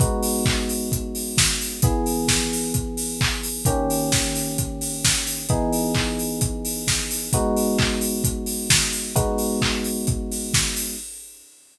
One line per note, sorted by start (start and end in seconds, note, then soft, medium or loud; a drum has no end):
0.00 1.80 G#3 medium
0.00 1.80 B3 medium
0.00 1.80 D#4 medium
0.00 1.80 F#4 medium
0.00 kick loud
0.00 closed hi-hat loud
0.23 open hi-hat loud
0.46 kick loud
0.46 clap loud
0.69 open hi-hat medium
0.92 kick loud
0.92 closed hi-hat loud
1.15 open hi-hat medium
1.37 kick loud
1.37 snare loud
1.61 open hi-hat medium
1.82 3.63 E3 medium
1.82 3.63 B3 medium
1.82 3.63 G#4 medium
1.82 kick loud
1.82 closed hi-hat loud
2.06 open hi-hat medium
2.28 kick medium
2.28 snare loud
2.53 open hi-hat medium
2.74 kick loud
2.74 closed hi-hat loud
2.97 open hi-hat medium
3.21 kick loud
3.21 clap loud
3.43 open hi-hat medium
3.65 5.46 D#3 medium
3.65 5.46 A#3 medium
3.65 5.46 C#4 medium
3.65 5.46 G4 medium
3.65 kick loud
3.65 closed hi-hat loud
3.90 open hi-hat medium
4.12 kick loud
4.12 snare loud
4.35 open hi-hat medium
4.58 kick medium
4.58 closed hi-hat loud
4.81 open hi-hat medium
5.05 kick medium
5.05 snare loud
5.27 open hi-hat medium
5.49 7.29 E3 medium
5.49 7.29 B3 medium
5.49 7.29 D#4 medium
5.49 7.29 G#4 medium
5.49 kick loud
5.49 closed hi-hat loud
5.73 open hi-hat medium
5.95 kick loud
5.95 clap loud
6.19 open hi-hat medium
6.41 kick loud
6.41 closed hi-hat loud
6.65 open hi-hat medium
6.87 kick medium
6.87 snare loud
7.11 open hi-hat loud
7.33 9.13 G#3 medium
7.33 9.13 B3 medium
7.33 9.13 D#4 medium
7.33 9.13 F#4 medium
7.33 kick loud
7.33 closed hi-hat loud
7.56 open hi-hat medium
7.79 kick loud
7.79 clap loud
8.01 open hi-hat medium
8.24 kick loud
8.24 closed hi-hat loud
8.46 open hi-hat medium
8.70 kick medium
8.70 snare loud
8.92 open hi-hat medium
9.15 10.95 G#3 medium
9.15 10.95 B3 medium
9.15 10.95 D#4 medium
9.15 10.95 F#4 medium
9.15 kick loud
9.15 closed hi-hat loud
9.38 open hi-hat medium
9.62 kick medium
9.62 clap loud
9.84 open hi-hat medium
10.07 kick loud
10.07 closed hi-hat loud
10.31 open hi-hat medium
10.54 kick medium
10.54 snare loud
10.76 open hi-hat medium